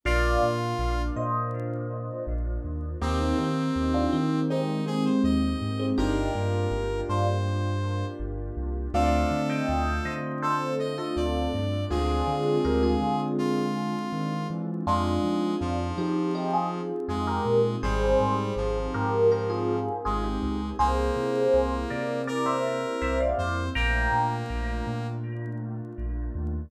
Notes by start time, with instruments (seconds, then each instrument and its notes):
0.04 synth bass 2 A#1, pad 2 (warm) A#3 D4 F4, acoustic grand piano A#3 D4 F4, brass section F4, electric piano 1 D5 F5
0.42 synth bass 2 A#2
0.79 synth bass 2 A#1
1.16 synth bass 2 A#2, electric piano 1 C5 D#5
2.27 synth bass 2 A#1
2.64 synth bass 2 D#2
3.02 synth bass 2 D#2, acoustic grand piano A#3 C4 D#4 G4, pad 2 (warm) A#3 C4 D#4 G4, brass section C4, electric piano 1 D#4 G4
3.20 electric piano 1 C4 D#4
3.38 synth bass 2 D#3, electric piano 1 C4 D#4
3.76 synth bass 2 D#2
3.94 electric piano 1 D4 F4
4.13 synth bass 2 D#3, electric piano 1 C4 D#4
4.50 electric piano 1 G#3 C4, brass section D#4
4.86 electric piano 1 G#3 C4, brass section G#4
5.05 brass section C5
5.24 synth bass 2 D#2, brass section D#5
5.61 synth bass 2 G#2
5.79 electric piano 1 G#3 C4
5.98 synth bass 2 G1, acoustic grand piano A#3 D4 F4 G4, pad 2 (warm) A#3 D4 F4 G4, electric piano 1 D#4 G4, brass section A#4
6.35 synth bass 2 G2
6.71 synth bass 2 G1
7.09 synth bass 2 G2, electric piano 1 D4 F4, brass section C5
8.20 synth bass 2 G1
8.57 synth bass 2 C2
8.94 synth bass 2 D2, acoustic grand piano A3 C4 D4 F4, pad 2 (warm) A3 C4 D4 F4, brass section A4, electric piano 1 D5 F5
9.31 synth bass 2 D3
9.50 electric piano 1 D#5 G5
9.69 synth bass 2 D2
10.05 synth bass 2 D3, electric piano 1 C5 D#5
10.42 brass section A4, electric piano 1 A4 C5
10.79 brass section D#5
10.98 electric piano 1 F4 A4, brass section D#5
11.16 synth bass 2 D2, brass section D5
11.53 synth bass 2 G2
11.90 synth bass 2 D2, pad 2 (warm) G#3 C4 D4 F4, acoustic grand piano G#3 C4 D4 F4, electric piano 1 F4 G#4, brass section G#4
12.27 synth bass 2 D3
12.65 synth bass 2 D2, electric piano 1 G4 A#4
12.83 electric piano 1 F4 G#4
13.01 synth bass 2 D3
13.38 brass section F4
14.12 synth bass 2 D#3
14.50 synth bass 2 E3
14.87 synth bass 2 F2, brass section G#3, pad 2 (warm) C4 D#4 F4 G#4, electric piano 1 D4 F4
15.24 synth bass 2 F3
15.61 synth bass 2 F2, brass section F3
15.98 synth bass 2 F3, electric piano 1 D#4 G4
16.35 electric piano 1 D#4 G4
16.53 electric piano 1 F4 G#4
17.08 synth bass 2 F2, brass section G#3, electric piano 1 F4 G#4
17.27 electric piano 1 G4 A#4
17.46 synth bass 2 A#2
17.83 synth bass 2 G#1, brass section G3, pad 2 (warm) C4 D#4 G4 G#4, electric piano 1 G#4 C5
18.20 synth bass 2 G#2
18.56 synth bass 2 G#1, brass section F3
18.94 synth bass 2 G#2, electric piano 1 G4 A#4
19.32 electric piano 1 G4 A#4
19.50 electric piano 1 F4 G#4
20.05 synth bass 2 G#1, brass section G#3, electric piano 1 F4 G#4
20.24 electric piano 1 D#4 G4
20.42 synth bass 2 C#2
20.78 synth bass 2 C2, pad 2 (warm) A#3 C4 E4 G4, brass section A#3, electric piano 1 G#4 C5
21.16 synth bass 2 C3
21.54 synth bass 2 C2
21.90 synth bass 2 C3, electric piano 1 A#4 D5
22.27 electric piano 1 A#4 D5, brass section A#4
22.46 electric piano 1 C5 E5
23.02 synth bass 2 C2, electric piano 1 C5 E5
23.20 electric piano 1 D5 F5
23.38 synth bass 2 F2, brass section C5
23.75 synth bass 2 A#1, pad 2 (warm) A3 A#3 D4 F4, brass section A#3, electric piano 1 G5 A#5
24.12 synth bass 2 A#2
24.50 synth bass 2 A#1
24.87 synth bass 2 A#2
25.98 synth bass 2 A#1
26.35 synth bass 2 D#2